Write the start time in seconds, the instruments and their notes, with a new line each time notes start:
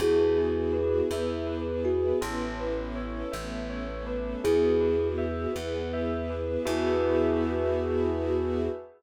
0.00 electric bass (finger) E2, string ensemble 1 B3 E4 F#4 G#4, kalimba E4 G#4, tubular bells F#4
0.38 tubular bells G#4
0.73 tubular bells B4
1.11 electric bass (finger) E2, string ensemble 1 B3 E4 G#4 B4, tubular bells E5
1.47 tubular bells B4
1.84 kalimba F#4, tubular bells G#4
2.21 electric bass (finger) A1, string ensemble 1 B3 C#4 E4 A4, tubular bells A4
2.60 tubular bells B4
2.95 tubular bells C#5
3.32 electric bass (finger) A1, string ensemble 1 A3 B3 C#4 A4, tubular bells E5
3.70 tubular bells C#5
4.06 tubular bells B4
4.44 electric bass (finger) E2, string ensemble 1 B3 E4 F#4 G#4, kalimba E4 G#4, tubular bells G#4
4.80 tubular bells B4
5.18 tubular bells E5
5.55 electric bass (finger) E2, string ensemble 1 B3 E4 G#4 B4, tubular bells F#5
5.93 tubular bells E5
6.30 tubular bells B4
6.65 electric bass (finger) E2, string ensemble 1 B3 E4 F#4 G#4, kalimba E4, tubular bells F#4 G#4 B4 E5